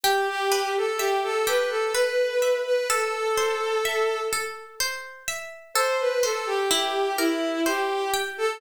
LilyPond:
<<
  \new Staff \with { instrumentName = "Violin" } { \time 3/4 \key a \minor \tempo 4 = 63 g'16 g'8 a'16 g'16 a'16 b'16 a'16 b'8. b'16 | a'4. r4. | c''16 b'16 a'16 g'16 g'8 e'8 g'8 r16 a'16 | }
  \new Staff \with { instrumentName = "Harpsichord" } { \time 3/4 \key a \minor g'8 b'8 e''8 g'8 b'8 e''8 | a'8 c''8 e''8 a'8 c''8 e''8 | a'8 c''8 e'8 bes'8 c''8 g''8 | }
>>